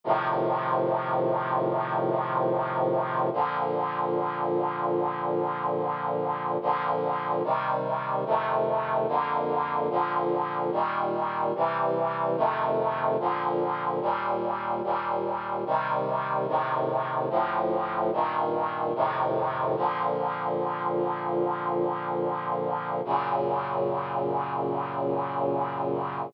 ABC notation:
X:1
M:4/4
L:1/8
Q:1/4=73
K:Bb
V:1 name="Brass Section"
[A,,C,E,F,]8 | [B,,D,F,]8 | [B,,D,F,]2 [C,E,G,]2 [F,,C,E,A,]2 [F,,D,B,]2 | [B,,D,F,]2 [B,,E,G,]2 [C,=E,G,]2 [F,,C,_E,A,]2 |
[B,,D,F,]2 [E,,B,,G,]2 [E,,B,,G,]2 [C,E,G,]2 | [A,,C,E,]2 [D,,A,,F,]2 [G,,B,,E,]2 [F,,A,,C,E,]2 | [B,,D,F,]8 | [_G,,B,,_D,]8 |]